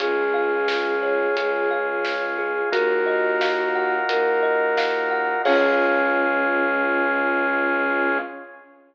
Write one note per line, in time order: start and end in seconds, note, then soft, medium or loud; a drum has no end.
0.00 1.26 C#2 medium
0.00 2.70 C#4 medium
0.00 2.70 F4 medium
0.00 0.68 G#4 medium
0.00 1.72 G#4 medium
0.00 2.70 G#4 medium
0.00 kick loud
0.00 closed hi-hat loud
0.34 1.70 F5 medium
0.68 1.36 G#4 medium
0.68 snare loud
1.02 2.04 C#5 medium
1.37 2.62 C#2 medium
1.37 2.38 G#4 medium
1.37 closed hi-hat loud
1.71 2.68 F5 medium
2.05 2.70 C#5 medium
2.05 snare loud
2.38 2.71 G#4 medium
2.71 3.99 D#2 medium
2.71 5.42 D#4 medium
2.71 5.42 F4 medium
2.71 3.96 F#4 medium
2.71 5.42 F#4 medium
2.71 5.42 A#4 medium
2.71 4.09 A#4 medium
2.71 kick loud
2.71 closed hi-hat loud
3.06 4.42 D#5 medium
3.41 4.77 F5 medium
3.41 snare loud
3.75 5.10 F#5 medium
4.09 5.34 D#2 medium
4.09 5.39 A#4 medium
4.09 closed hi-hat loud
4.43 5.40 D#5 medium
4.77 5.42 F5 medium
4.77 snare loud
5.11 5.43 F#5 medium
5.45 8.18 C#2 loud
5.45 8.18 C#4 loud
5.45 8.19 C#4 loud
5.45 8.18 F4 loud
5.45 8.17 G#4 medium
5.45 8.18 G#4 loud
5.45 8.17 C#5 medium
5.45 8.17 F5 loud
5.45 kick loud
5.45 crash loud